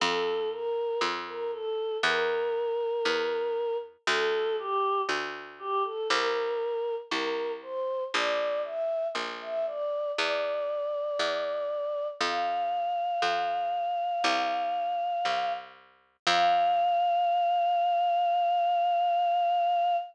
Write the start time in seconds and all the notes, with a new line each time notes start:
0.00 F2 A4
0.51 A#4
1.01 F2
1.27 A#4
1.52 A4
2.03 E2 A#4
3.05 E2
4.07 D2 A4
4.59 G4
5.09 D2
5.59 G4
5.84 A4
6.10 C2 A#4
7.11 C2 A#4
7.62 C5
8.14 A#1 D5
8.64 E5
9.15 A#1
9.42 E5
9.66 D5
10.16 E2 D5
11.19 E2
12.21 F2 F5
13.22 F2
14.24 C2
15.25 C2
16.27 F2 F5